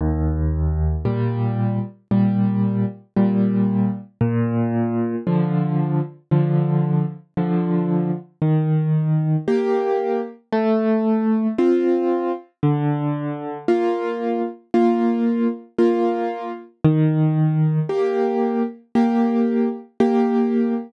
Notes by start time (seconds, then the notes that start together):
0.01 D#2
1.05 A#2 G3
2.11 A#2 G3
3.16 A#2 G3
4.21 A#2
5.27 D3 F3
6.31 D3 F3
7.37 D3 F3
8.42 D#3
9.48 A#3 G4
10.52 A3
11.58 C4 F4
12.63 D3
13.68 A#3 F4
14.74 A#3 F4
15.79 A#3 F4
16.84 D#3
17.89 A#3 G4
18.95 A#3 G4
20.00 A#3 G4